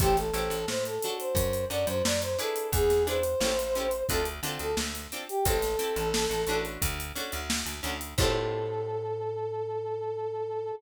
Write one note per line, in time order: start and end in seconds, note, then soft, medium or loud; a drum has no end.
0.00 0.31 A1 medium
0.00 0.13 E4 medium
0.00 0.16 G4 loud
0.00 0.13 G4 medium
0.00 0.13 A4 medium
0.00 0.13 C5 medium
0.00 kick loud
0.00 closed hi-hat loud
0.17 0.66 A4 loud
0.17 snare soft
0.17 closed hi-hat medium
0.34 0.49 A1 medium
0.34 0.57 E4 medium
0.34 0.57 G4 medium
0.34 0.57 A4 medium
0.34 0.57 C5 medium
0.34 closed hi-hat medium
0.50 0.65 A1 medium
0.50 closed hi-hat medium
0.68 0.99 A2 medium
0.68 0.84 C5 medium
0.68 snare medium
0.85 1.14 A4 medium
0.85 closed hi-hat medium
1.02 1.50 D4 medium
1.02 1.50 F#4 medium
1.02 1.50 A4 medium
1.02 1.50 C#5 medium
1.02 closed hi-hat medium
1.19 1.65 C5 medium
1.19 closed hi-hat medium
1.35 1.65 F#2 medium
1.35 kick medium
1.35 closed hi-hat loud
1.53 closed hi-hat medium
1.70 1.85 F#2 medium
1.70 1.94 D4 medium
1.70 1.94 F#4 medium
1.70 1.94 A4 medium
1.70 1.94 C#5 medium
1.70 1.87 D5 medium
1.70 closed hi-hat medium
1.87 2.02 F#2 medium
1.87 2.04 C5 loud
1.87 closed hi-hat medium
2.05 2.36 F#2 medium
2.05 2.21 D5 medium
2.05 snare loud
2.22 2.38 C5 medium
2.22 closed hi-hat medium
2.38 2.85 D4 medium
2.38 2.85 E4 medium
2.38 2.85 G#4 medium
2.38 2.68 A4 loud
2.38 2.85 B4 medium
2.38 closed hi-hat medium
2.56 closed hi-hat medium
2.72 3.35 E2 medium
2.72 3.03 G#4 loud
2.72 kick loud
2.72 closed hi-hat loud
2.90 snare medium
2.90 closed hi-hat medium
3.07 3.19 D4 medium
3.07 3.19 E4 medium
3.07 3.19 G#4 medium
3.07 3.19 B4 medium
3.07 4.04 C5 loud
3.07 closed hi-hat medium
3.23 closed hi-hat medium
3.40 4.03 A1 medium
3.40 3.53 C#4 medium
3.40 3.53 E4 medium
3.40 3.53 G4 medium
3.40 3.53 A4 medium
3.40 snare loud
3.59 closed hi-hat medium
3.75 3.87 C#4 medium
3.75 3.87 E4 medium
3.75 3.87 G4 medium
3.75 3.87 A4 medium
3.75 closed hi-hat medium
3.91 closed hi-hat medium
4.09 4.40 D2 medium
4.09 4.21 C4 medium
4.09 4.21 D4 medium
4.09 4.21 F4 medium
4.09 4.25 A4 loud
4.09 4.21 A4 medium
4.09 kick medium
4.09 closed hi-hat medium
4.25 closed hi-hat medium
4.43 4.58 D3 medium
4.43 4.67 C4 medium
4.43 4.67 D4 medium
4.43 4.67 F4 medium
4.43 4.67 A4 medium
4.43 closed hi-hat medium
4.59 4.75 D2 medium
4.59 4.76 A4 loud
4.59 closed hi-hat medium
4.77 5.08 D2 medium
4.77 snare loud
4.95 closed hi-hat medium
5.12 5.24 C4 medium
5.12 5.24 D4 medium
5.12 5.24 F4 medium
5.12 5.24 A4 medium
5.12 closed hi-hat medium
5.29 5.45 G4 medium
5.29 closed hi-hat medium
5.45 5.76 A1 medium
5.45 5.57 C4 medium
5.45 5.57 E4 medium
5.45 5.57 G4 medium
5.45 6.62 A4 loud
5.45 5.57 A4 medium
5.45 kick loud
5.45 closed hi-hat loud
5.62 snare medium
5.62 closed hi-hat medium
5.79 6.03 C4 medium
5.79 6.03 E4 medium
5.79 6.03 G4 medium
5.79 6.03 A4 medium
5.79 closed hi-hat medium
5.96 6.27 A1 medium
5.96 closed hi-hat medium
6.14 snare loud
6.30 6.45 A1 medium
6.30 closed hi-hat medium
6.47 6.78 A1 medium
6.47 6.94 C#4 medium
6.47 6.94 D4 medium
6.47 6.94 F#4 medium
6.47 6.94 A4 medium
6.47 closed hi-hat medium
6.65 closed hi-hat medium
6.82 7.12 D2 medium
6.82 kick medium
6.82 closed hi-hat loud
7.00 closed hi-hat medium
7.15 7.39 C#4 medium
7.15 7.39 D4 medium
7.15 7.39 F#4 medium
7.15 7.39 A4 medium
7.15 snare soft
7.15 closed hi-hat medium
7.32 7.64 D2 medium
7.32 closed hi-hat medium
7.50 snare loud
7.66 7.81 D2 medium
7.66 snare soft
7.66 closed hi-hat medium
7.83 8.14 D2 medium
7.83 7.95 C#4 medium
7.83 7.95 D4 medium
7.83 7.95 F#4 medium
7.83 7.95 A4 medium
7.83 closed hi-hat medium
8.01 closed hi-hat medium
8.18 10.72 A2 loud
8.18 10.72 E4 loud
8.18 10.72 G4 loud
8.18 10.72 A4 loud
8.18 10.72 C5 loud
8.18 kick loud
8.18 crash loud